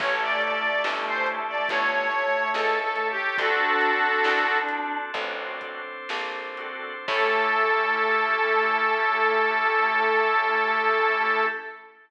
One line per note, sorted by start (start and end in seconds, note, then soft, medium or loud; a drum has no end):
0.00 0.76 A1 loud
0.00 3.11 A3 medium
0.00 0.59 C#4 loud
0.00 1.68 C#4 medium
0.00 0.59 E4 medium
0.00 1.68 E4 medium
0.00 0.59 G4 medium
0.00 1.68 G4 medium
0.00 0.59 A4 loud
0.00 1.68 A4 medium
0.00 0.20 C#5 medium
0.00 kick loud
0.00 crash loud
0.21 0.42 D5 medium
0.42 0.83 D5 medium
0.42 closed hi-hat medium
0.84 1.60 G1 medium
0.84 1.44 C#4 medium
0.84 1.44 E4 medium
0.84 1.44 G4 medium
0.84 1.44 A4 medium
0.84 snare loud
1.07 1.27 C5 medium
1.26 closed hi-hat medium
1.48 1.68 D5 medium
1.68 2.46 G1 medium
1.68 3.37 C#4 medium
1.68 3.37 E4 medium
1.68 3.37 A4 medium
1.68 2.50 C#5 medium
1.68 3.37 C#5 medium
1.68 kick medium
1.68 closed hi-hat loud
2.11 closed hi-hat medium
2.53 3.30 C#2 medium
2.53 2.80 A4 medium
2.53 snare medium
2.82 3.08 A4 medium
2.96 closed hi-hat medium
3.10 3.37 G4 medium
3.37 4.16 D2 medium
3.37 5.12 C4 medium
3.37 3.98 C4 medium
3.37 5.12 D4 medium
3.37 3.98 D4 loud
3.37 4.98 D4 loud
3.37 5.12 F#4 medium
3.37 3.98 F#4 loud
3.37 4.58 F#4 medium
3.37 5.12 A4 medium
3.37 3.98 A4 loud
3.37 4.58 A4 medium
3.37 kick loud
3.37 closed hi-hat medium
3.81 closed hi-hat medium
4.24 5.06 C2 medium
4.24 snare loud
4.69 closed hi-hat medium
5.14 5.99 A1 medium
5.14 5.80 C4 medium
5.14 7.06 C4 medium
5.14 5.80 D4 medium
5.14 7.06 D4 medium
5.14 5.80 F#4 medium
5.14 5.80 A4 medium
5.14 7.06 A4 medium
5.14 7.06 C5 medium
5.14 kick medium
5.14 closed hi-hat medium
5.61 kick medium
5.61 closed hi-hat medium
6.09 6.99 A#1 medium
6.09 snare loud
6.57 6.93 C4 medium
6.57 6.93 D4 medium
6.57 6.93 F#4 medium
6.57 6.93 A4 loud
6.57 closed hi-hat medium
7.08 11.45 A2 loud
7.08 11.45 A3 loud
7.08 11.45 C#4 medium
7.08 11.45 C#4 loud
7.08 11.45 E4 loud
7.08 11.45 G4 medium
7.08 11.45 A4 loud
7.08 11.46 A4 loud
7.08 kick loud
7.08 crash loud